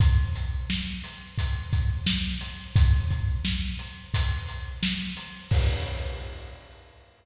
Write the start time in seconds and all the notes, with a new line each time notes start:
0.00 kick, closed hi-hat
0.35 closed hi-hat
0.70 snare
1.04 closed hi-hat
1.38 kick, closed hi-hat
1.73 kick, closed hi-hat
2.06 snare
2.41 closed hi-hat
2.76 kick, closed hi-hat
3.10 kick, closed hi-hat
3.45 snare
3.79 closed hi-hat
4.14 kick, closed hi-hat
4.48 closed hi-hat
4.83 snare
5.17 closed hi-hat
5.51 kick, crash